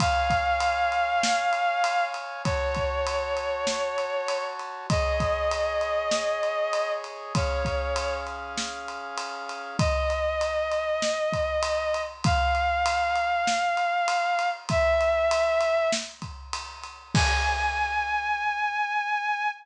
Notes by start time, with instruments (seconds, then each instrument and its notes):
0.00 brass section C#5 F5 G#5, violin F5, kick, ride
0.30 kick, ride
0.60 ride
0.92 ride
1.23 snare
1.53 ride
1.84 ride
2.14 ride
2.44 brass section F#4 C#5 A5, violin C#5, kick, ride
2.75 kick, ride
3.07 ride
3.37 ride
3.67 snare
3.98 ride
4.28 ride
4.59 ride
4.90 brass section G#4 C#5 D#5, violin D#5, kick, ride
5.20 kick, ride
5.51 ride
5.81 ride
6.11 snare
6.43 ride
6.73 ride
7.04 ride
7.34 brass section C#4 G#4 F5, violin C#5, kick, ride
7.65 kick, ride
7.96 ride
8.27 ride
8.58 snare
8.88 ride
9.18 ride
9.49 ride
9.79 violin D#5, kick, ride
10.10 ride
10.41 ride
10.72 ride
11.02 snare
11.33 kick, ride
11.63 ride
11.94 ride
12.24 violin F5, kick, ride
12.55 ride
12.86 ride
13.16 ride
13.47 snare
13.77 ride
14.08 ride
14.39 ride
14.69 violin E5, kick, ride
15.01 ride
15.31 ride
15.61 ride
15.92 snare
16.22 kick, ride
16.53 ride
16.84 ride
17.15 violin G#5, kick, crash